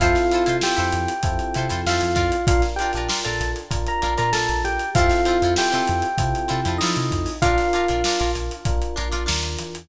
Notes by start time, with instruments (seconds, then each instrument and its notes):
0.00 synth bass 1 F2, electric piano 1 C4 E4 F4 A4 F5, acoustic guitar (steel) E4 F4 A4 C5, kick, closed hi-hat
0.15 snare, closed hi-hat
0.31 acoustic guitar (steel) E4 F4 A4 C5, closed hi-hat
0.46 synth bass 1 C3, acoustic guitar (steel) E4 F4 A4 C5, closed hi-hat
0.61 acoustic guitar (steel) E4 F4 A4, electric piano 1 G4 G5, snare
0.65 acoustic guitar (steel) C5
0.76 synth bass 1 F2, acoustic guitar (steel) E4 F4 A4 C5, closed hi-hat
0.92 synth bass 1 F2, closed hi-hat
1.08 closed hi-hat
1.23 synth bass 1 F2, electric piano 1 C4 E4 F4 A4, kick, closed hi-hat
1.39 closed hi-hat
1.54 synth bass 1 C3, acoustic guitar (steel) E4 F4 A4 C5, closed hi-hat
1.69 synth bass 1 F2, acoustic guitar (steel) E4 F4 A4 C5, snare, closed hi-hat
1.86 synth bass 1 F2, acoustic guitar (steel) E4 F4 A4 C5, electric piano 1 F4 F5, snare
2.01 synth bass 1 F2, closed hi-hat
2.15 synth bass 1 F2, acoustic guitar (steel) D4 F4 A#4, kick, snare, closed hi-hat
2.32 closed hi-hat
2.47 synth bass 1 A#1, electric piano 1 D4 F4 A#4 F5, kick, closed hi-hat
2.62 snare, closed hi-hat
2.76 acoustic guitar (steel) D4, electric piano 1 G4 G5, closed hi-hat
2.81 acoustic guitar (steel) F4 A#4
2.93 synth bass 1 A#1, acoustic guitar (steel) D4 F4, closed hi-hat
2.97 acoustic guitar (steel) A#4
3.09 acoustic guitar (steel) D4 F4 A#4, snare
3.24 synth bass 1 A#1, acoustic guitar (steel) D4 F4 A#4, electric piano 1 A4 A5, snare, closed hi-hat
3.40 synth bass 1 A#1, snare, closed hi-hat
3.56 closed hi-hat
3.71 synth bass 1 A#1, electric piano 1 D4 F4 A#4, kick, closed hi-hat
3.86 electric piano 1 A#4 A#5, closed hi-hat
4.02 synth bass 1 A#1, acoustic guitar (steel) D4 F4 A#4, closed hi-hat
4.17 synth bass 1 A#2, acoustic guitar (steel) D4 F4 A#4, electric piano 1 A#4 A#5, closed hi-hat
4.33 synth bass 1 A#1, acoustic guitar (steel) D4 F4 A#4, electric piano 1 A4 A5, snare
4.49 synth bass 1 A#1, closed hi-hat
4.64 synth bass 1 A#1, electric piano 1 G4 G5, closed hi-hat
4.79 closed hi-hat
4.95 synth bass 1 F2, electric piano 1 C4 E4 F4 A4 F5, acoustic guitar (steel) C4 E4 F4, kick, closed hi-hat
4.99 acoustic guitar (steel) A4
5.09 snare, closed hi-hat
5.25 acoustic guitar (steel) C4 E4 F4 A4, closed hi-hat
5.42 synth bass 1 F2, acoustic guitar (steel) C4 E4 F4 A4, closed hi-hat
5.56 acoustic guitar (steel) C4 E4 F4 A4, electric piano 1 G4 G5, snare
5.72 synth bass 1 C3, acoustic guitar (steel) C4 E4 F4 A4, closed hi-hat
5.88 synth bass 1 F2, closed hi-hat
6.02 closed hi-hat
6.18 synth bass 1 C3, electric piano 1 C4 E4 F4 A4, kick, closed hi-hat
6.35 closed hi-hat
6.48 synth bass 1 C3, acoustic guitar (steel) C4 E4 F4 A4, snare, closed hi-hat
6.65 synth bass 1 F2, acoustic guitar (steel) C4 E4 F4 A4, closed hi-hat
6.78 synth bass 1 F3, acoustic guitar (steel) C4 E4, electric piano 1 D#4 D#5, snare
6.83 acoustic guitar (steel) F4 A4
6.96 synth bass 1 C3, closed hi-hat
7.11 synth bass 1 F2, kick, closed hi-hat
7.26 open hi-hat
7.42 synth bass 1 A#1, electric piano 1 D4 F4 A#4 F5, acoustic guitar (steel) D4 F4 A#4, kick, closed hi-hat
7.58 snare, closed hi-hat
7.73 acoustic guitar (steel) D4 F4 A#4, closed hi-hat
7.88 synth bass 1 A#1, acoustic guitar (steel) D4 F4 A#4, closed hi-hat
8.04 acoustic guitar (steel) D4 F4 A#4, snare
8.19 synth bass 1 A#1, acoustic guitar (steel) D4 F4 A#4, closed hi-hat
8.35 synth bass 1 A#1, closed hi-hat
8.51 closed hi-hat
8.65 synth bass 1 A#1, electric piano 1 D4 F4 A#4, kick, closed hi-hat
8.82 closed hi-hat
8.96 synth bass 1 A#1, acoustic guitar (steel) D4 F4 A#4, closed hi-hat
9.12 synth bass 1 A#1, acoustic guitar (steel) D4 F4 A#4, closed hi-hat
9.26 synth bass 1 D#2, acoustic guitar (steel) D4 F4 A#4, snare
9.43 closed hi-hat
9.59 synth bass 1 E2, closed hi-hat
9.75 closed hi-hat